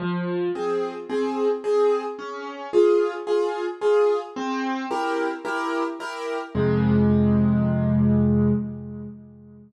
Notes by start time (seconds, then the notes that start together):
0.00 F3
0.55 C4 G#4
1.09 C4 G#4
1.64 C4 G#4
2.19 C#4
2.73 F4 G#4
3.27 F4 G#4
3.81 F4 G#4
4.36 C4
4.91 E4 G4 A#4
5.45 E4 G4 A#4
6.00 E4 G4 A#4
6.55 F2 C3 G#3